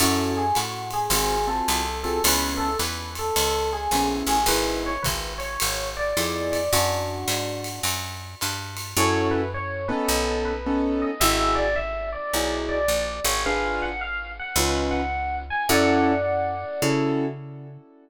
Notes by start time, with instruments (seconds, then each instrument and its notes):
0.00 electric bass (finger) F#2, acoustic grand piano C#4 E4 F#4 A4, electric piano 1 F#4, ride
0.37 electric piano 1 G#4
0.55 electric bass (finger) A2, electric piano 1 F#4, hi-hat pedal, ride
0.91 electric piano 1 G#4, ride
1.10 electric bass (finger) G#1, acoustic grand piano C4 F4 F#4 G#4, ride
1.47 acoustic grand piano C4 F4 F#4 G#4, electric piano 1 A4
1.68 electric bass (finger) C2, hi-hat pedal, ride
2.03 acoustic grand piano C4 F4 F#4 G#4, electric piano 1 A4, ride
2.24 electric bass (finger) C#2, acoustic grand piano B3 C#4 E4 G#4, electric piano 1 B4, ride
2.57 electric piano 1 A4
2.79 electric bass (finger) E2, electric piano 1 B4, hi-hat pedal, ride
3.15 electric piano 1 A4, ride
3.36 electric bass (finger) C#2, ride
3.73 electric piano 1 G#4
3.91 electric bass (finger) A#1, acoustic grand piano B3 C#4 E4 G#4, hi-hat pedal, ride
4.27 electric bass (finger) A1, electric piano 1 G#4, ride
4.46 electric bass (finger) G#1, acoustic grand piano B3 D#4 E4 G#4, electric piano 1 B4, ride
4.86 electric piano 1 C#5
5.03 electric bass (finger) G#1, electric piano 1 B4, kick, hi-hat pedal, ride
5.38 electric piano 1 C#5, ride
5.60 electric bass (finger) G#1, ride
5.97 electric piano 1 D5
6.17 electric bass (finger) F2, acoustic grand piano B3 D#4 E4 G#4, hi-hat pedal, ride
6.52 electric piano 1 D5, ride
6.73 electric bass (finger) F#2, electric piano 1 D4 F#4, ride
7.28 electric bass (finger) G#2, hi-hat pedal, ride
7.64 ride
7.83 electric bass (finger) F#2, ride
8.41 electric bass (finger) G2, hi-hat pedal, ride
8.77 ride
8.97 electric bass (finger) F#2, acoustic grand piano C#4 E4 F#4 A4, electric piano 1 C#5
9.31 electric piano 1 B4
9.54 electric piano 1 C#5
9.88 acoustic grand piano B3 C#4 D#4 A4, electric piano 1 B4
10.08 electric bass (finger) B1
10.45 electric piano 1 B4
10.66 acoustic grand piano B3 C#4 D#4 A4
11.02 electric piano 1 D#5
11.20 electric bass (finger) G#1, acoustic grand piano D#4 E4 F#4 G#4, electric piano 1 E5
11.55 electric piano 1 D5
11.76 electric piano 1 E5
12.13 electric piano 1 D5
12.34 electric bass (finger) B1, acoustic grand piano D#4 E4 F#4 G#4
12.69 electric piano 1 D5
12.88 electric bass (finger) A#1
13.24 electric bass (finger) G#1, electric piano 1 C#5
13.46 acoustic grand piano D4 F4 G#4 B4, electric piano 1 F5
13.82 electric piano 1 F#5
14.01 electric piano 1 F5
14.39 electric piano 1 F#5
14.56 electric bass (finger) C#2, acoustic grand piano C#4 D#4 F4 B4
14.91 electric piano 1 F#5
15.50 electric piano 1 G#5
15.69 electric bass (finger) F#2, acoustic grand piano C#4 E4 F#4 A4, electric piano 1 D5 F#5
16.82 electric bass (finger) C#3, acoustic grand piano C#4 E4 F#4 A4